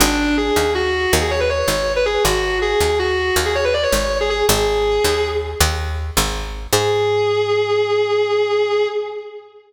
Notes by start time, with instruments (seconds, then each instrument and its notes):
0.00 electric bass (finger) G#1, distortion guitar D4
0.37 distortion guitar G#4
0.56 electric bass (finger) D#2
0.75 distortion guitar F#4
1.13 electric bass (finger) D#2
1.21 distortion guitar G#4
1.31 distortion guitar C#5
1.40 distortion guitar B4
1.50 distortion guitar C#5
1.59 distortion guitar C#5
1.68 electric bass (finger) G#1
1.96 distortion guitar B4
2.06 distortion guitar G#4
2.24 electric bass (finger) G#1, distortion guitar F#4
2.62 distortion guitar G#4
2.80 electric bass (finger) D#2
2.99 distortion guitar F#4
3.36 electric bass (finger) D#2
3.46 distortion guitar G#4
3.55 distortion guitar C#5
3.64 distortion guitar B4
3.74 distortion guitar D5
3.83 distortion guitar C#5
3.92 electric bass (finger) G#1
4.21 distortion guitar G#4
4.30 distortion guitar G#4
4.49 electric bass (finger) G#1, distortion guitar G#4
5.04 electric bass (finger) D#2
5.60 electric bass (finger) D#2
6.17 electric bass (finger) G#1
6.73 electric bass (finger) G#2, distortion guitar G#4